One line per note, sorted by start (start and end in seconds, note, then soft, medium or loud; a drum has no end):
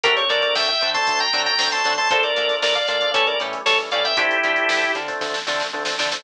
0.03 0.18 D2 medium
0.03 0.25 F#3 medium
0.03 0.25 A3 medium
0.03 0.13 C4 loud
0.03 0.25 C4 medium
0.03 0.25 D4 medium
0.03 0.13 D4 loud
0.03 0.13 F#4 loud
0.03 0.16 G4 medium
0.03 0.13 A4 loud
0.03 0.16 A#4 loud
0.03 kick loud
0.03 closed hi-hat loud
0.17 0.29 C#5 medium
0.17 closed hi-hat medium
0.29 0.45 D3 medium
0.29 0.70 F#3 medium
0.29 0.70 A3 medium
0.29 0.70 C4 medium
0.29 0.47 C4 medium
0.29 0.70 D4 medium
0.29 0.47 D4 medium
0.29 0.47 F#4 loud
0.29 0.47 A4 medium
0.29 0.42 A#4 medium
0.29 0.42 D5 medium
0.29 closed hi-hat medium
0.42 0.55 A#4 medium
0.42 0.55 D5 medium
0.42 snare soft
0.42 closed hi-hat medium
0.55 0.70 D2 medium
0.55 0.68 E5 medium
0.55 0.68 G5 medium
0.55 snare loud
0.68 0.90 E5 medium
0.68 0.90 G5 medium
0.68 kick medium
0.68 closed hi-hat medium
0.81 0.97 D3 medium
0.81 0.99 C4 medium
0.81 0.99 D4 medium
0.81 0.99 F#4 medium
0.81 0.99 A4 loud
0.81 closed hi-hat medium
0.94 1.25 F#3 medium
0.94 1.25 A3 medium
0.94 1.25 C4 medium
0.94 1.25 D4 medium
0.94 1.19 A5 medium
0.94 1.19 C6 medium
0.94 kick medium
0.94 closed hi-hat medium
1.07 1.23 D2 medium
1.07 kick loud
1.07 closed hi-hat loud
1.20 1.42 G5 medium
1.20 1.42 A#5 medium
1.20 closed hi-hat medium
1.33 1.48 D3 medium
1.33 1.54 F#3 medium
1.33 1.54 A3 medium
1.33 1.51 C4 loud
1.33 1.54 C4 medium
1.33 1.54 D4 medium
1.33 1.51 D4 medium
1.33 1.51 F#4 medium
1.33 1.51 A4 medium
1.33 closed hi-hat medium
1.46 1.69 G5 medium
1.46 1.69 A#5 medium
1.46 closed hi-hat medium
1.58 1.74 D2 medium
1.58 1.69 F#3 medium
1.58 1.69 A3 medium
1.58 1.69 C4 medium
1.58 1.69 D4 medium
1.58 snare loud
1.72 1.82 F#3 medium
1.72 1.82 A3 medium
1.72 1.82 C4 medium
1.72 1.82 D4 medium
1.72 1.94 A5 medium
1.72 1.94 C6 medium
1.72 closed hi-hat medium
1.85 1.99 D3 medium
1.85 1.95 F#3 medium
1.85 1.95 A3 medium
1.85 1.95 C4 medium
1.85 1.94 C4 medium
1.85 1.95 D4 medium
1.85 1.94 D4 medium
1.85 1.94 F#4 medium
1.85 1.94 A4 medium
1.85 closed hi-hat medium
1.98 2.08 F#3 medium
1.98 2.08 A3 medium
1.98 2.08 C4 medium
1.98 2.08 D4 medium
1.98 2.10 A5 medium
1.98 2.10 C6 medium
1.98 closed hi-hat medium
2.10 2.26 A#1 medium
2.10 2.32 F3 medium
2.10 2.32 A3 medium
2.10 2.32 A#3 medium
2.10 2.20 D4 loud
2.10 2.32 D4 medium
2.10 2.20 F4 loud
2.10 2.23 A4 medium
2.10 2.20 A4 loud
2.10 2.20 A#4 loud
2.10 2.23 C5 medium
2.10 kick loud
2.10 closed hi-hat loud
2.23 2.55 A#4 medium
2.23 2.55 D5 medium
2.23 snare soft
2.23 closed hi-hat medium
2.36 2.52 A#2 medium
2.36 2.78 F3 medium
2.36 2.78 A3 medium
2.36 2.78 A#3 medium
2.36 2.54 D4 medium
2.36 2.78 D4 medium
2.36 2.54 F4 medium
2.36 2.54 A4 medium
2.36 2.54 A#4 medium
2.36 closed hi-hat medium
2.49 snare soft
2.49 closed hi-hat medium
2.62 2.77 A#1 medium
2.62 2.75 A#4 medium
2.62 2.75 D5 medium
2.62 snare loud
2.75 2.87 D5 medium
2.75 2.87 F5 medium
2.75 kick medium
2.75 closed hi-hat medium
2.88 3.03 A#2 medium
2.88 2.97 D4 medium
2.88 2.97 F4 medium
2.88 2.97 A4 medium
2.88 2.97 A#4 medium
2.88 3.10 D5 medium
2.88 3.10 F5 medium
2.88 closed hi-hat medium
3.01 3.12 F3 medium
3.01 3.12 A3 medium
3.01 3.12 A#3 medium
3.01 3.12 D4 medium
3.01 kick medium
3.01 closed hi-hat medium
3.14 3.29 A1 medium
3.14 3.35 E3 medium
3.14 3.35 G3 medium
3.14 3.35 A3 medium
3.14 3.23 C#4 loud
3.14 3.35 C#4 medium
3.14 3.23 E4 loud
3.14 3.23 G4 loud
3.14 3.26 A4 medium
3.14 3.23 A4 loud
3.14 3.26 C#5 medium
3.14 kick loud
3.14 closed hi-hat loud
3.27 3.39 A#4 medium
3.27 3.39 D5 medium
3.27 closed hi-hat medium
3.40 3.55 A2 medium
3.40 3.61 E3 medium
3.40 3.61 G3 medium
3.40 3.61 A3 medium
3.40 3.61 C#4 medium
3.40 3.58 C#4 medium
3.40 3.58 E4 medium
3.40 3.58 G4 loud
3.40 3.58 A4 loud
3.40 closed hi-hat medium
3.53 closed hi-hat medium
3.66 3.81 A1 medium
3.66 3.77 E3 medium
3.66 3.77 G3 medium
3.66 3.77 A3 medium
3.66 3.77 C#4 medium
3.66 3.78 A4 medium
3.66 3.78 C#5 medium
3.66 snare loud
3.79 3.89 E3 medium
3.79 3.89 G3 medium
3.79 3.89 A3 medium
3.79 3.89 C#4 medium
3.79 closed hi-hat medium
3.91 4.07 A2 medium
3.91 4.02 E3 medium
3.91 4.02 G3 medium
3.91 4.02 A3 medium
3.91 4.02 C#4 medium
3.91 4.01 C#4 medium
3.91 4.01 E4 medium
3.91 4.01 G4 medium
3.91 4.01 A4 medium
3.91 4.04 D5 medium
3.91 4.04 F5 medium
3.91 closed hi-hat medium
4.04 4.14 E3 medium
4.04 4.14 G3 medium
4.04 4.14 A3 medium
4.04 4.14 C#4 medium
4.04 4.17 E5 medium
4.04 4.17 G5 medium
4.04 closed hi-hat medium
4.17 4.32 D2 medium
4.17 4.37 F3 medium
4.17 4.37 A3 medium
4.17 4.37 C4 medium
4.17 4.27 C4 loud
4.17 4.37 D4 medium
4.17 4.27 D4 loud
4.17 4.92 E4 medium
4.17 4.27 F4 loud
4.17 4.92 G4 loud
4.17 4.27 A4 loud
4.17 kick loud
4.17 closed hi-hat loud
4.31 closed hi-hat medium
4.43 4.59 D3 medium
4.43 4.85 F3 medium
4.43 4.85 A3 medium
4.43 4.85 C4 medium
4.43 4.62 C4 loud
4.43 4.85 D4 medium
4.43 4.62 D4 loud
4.43 4.62 F4 medium
4.43 4.62 A4 loud
4.43 closed hi-hat medium
4.56 closed hi-hat medium
4.69 4.84 D2 medium
4.69 snare loud
4.82 kick medium
4.82 snare soft
4.82 closed hi-hat medium
4.95 5.09 D3 medium
4.95 5.13 C4 medium
4.95 5.13 D4 medium
4.95 5.13 F4 medium
4.95 5.13 A4 medium
4.95 closed hi-hat medium
5.08 5.39 F3 medium
5.08 5.39 A3 medium
5.08 5.39 C4 medium
5.08 5.39 D4 medium
5.08 kick medium
5.08 snare soft
5.08 closed hi-hat medium
5.21 5.36 D2 medium
5.21 kick medium
5.21 snare medium
5.34 snare medium
5.46 5.62 D3 medium
5.46 5.67 F3 medium
5.46 5.67 A3 medium
5.46 5.67 C4 medium
5.46 5.65 C4 medium
5.46 5.67 D4 medium
5.46 5.65 D4 medium
5.46 5.65 F4 loud
5.46 5.65 A4 medium
5.46 snare medium
5.60 snare medium
5.73 5.88 D2 medium
5.73 5.83 F3 medium
5.73 5.83 A3 medium
5.73 5.83 C4 medium
5.73 5.83 D4 medium
5.85 5.96 F3 medium
5.85 5.96 A3 medium
5.85 5.96 C4 medium
5.85 5.96 D4 medium
5.85 snare loud
5.98 6.14 D3 medium
5.98 6.09 F3 medium
5.98 6.09 A3 medium
5.98 6.07 C4 medium
5.98 6.09 C4 medium
5.98 6.09 D4 medium
5.98 6.07 D4 medium
5.98 6.07 F4 medium
5.98 6.07 A4 medium
5.98 snare loud
6.12 6.22 F3 medium
6.12 6.22 A3 medium
6.12 6.22 C4 medium
6.12 6.22 D4 medium
6.12 snare loud